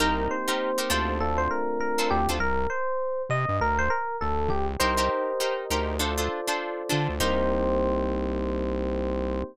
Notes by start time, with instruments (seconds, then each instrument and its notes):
0.00 synth bass 1 C2, electric piano 1 A#3 C4 D#4 G4 A#4, acoustic guitar (steel) D#4 G4 A#4 C5
0.30 electric piano 1 C5
0.48 acoustic guitar (steel) D#4 G4 A#4 C5
0.78 acoustic guitar (steel) D#4 G4 A#4 C5
0.90 synth bass 1 D2, acoustic guitar (steel) D4 F4 A4 C5, electric piano 1 C5
1.20 electric piano 1 A3 C4 D4 F4 A4
1.37 electric piano 1 C5
1.50 electric piano 1 A#4
1.80 electric piano 1 A#4
1.98 acoustic guitar (steel) D4 F4 A4 C5
2.10 synth bass 1 D2, electric piano 1 G4
2.29 synth bass 1 D2, acoustic guitar (steel) D4 F4 A4 C5
2.40 synth bass 1 C2, electric piano 1 A#4
2.70 electric piano 1 C5
3.29 synth bass 1 C3, electric piano 1 D#5
3.49 synth bass 1 G2
3.61 synth bass 1 D2, electric piano 1 A#4
3.78 electric piano 1 C5
3.90 electric piano 1 A#4
4.21 synth bass 1 D2, electric piano 1 A4
4.49 synth bass 1 C#2, electric piano 1 G4
4.79 synth bass 1 C2, acoustic guitar (steel) D#4 G4 A#4 C5, electric piano 1 G4 A#4 C5 D#5
4.97 acoustic guitar (steel) D#4 G4 A#4 C5
5.40 acoustic guitar (steel) D#4 G4 A#4 C5
5.70 synth bass 1 D2, acoustic guitar (steel) D#4 G4 A#4 C5
5.99 acoustic guitar (steel) D4 F4 A4 C5, electric piano 1 F4 A4 C5 D5
6.18 acoustic guitar (steel) D4 F4 A4 C5
6.48 acoustic guitar (steel) D4 F4 A4 C5
6.89 synth bass 1 D3, acoustic guitar (steel) D4 F4 A4 C5
7.09 synth bass 1 D2
7.20 synth bass 1 C2, electric piano 1 A#3 C4 D#4 G4 C5, acoustic guitar (steel) D#4 G4 A#4 C5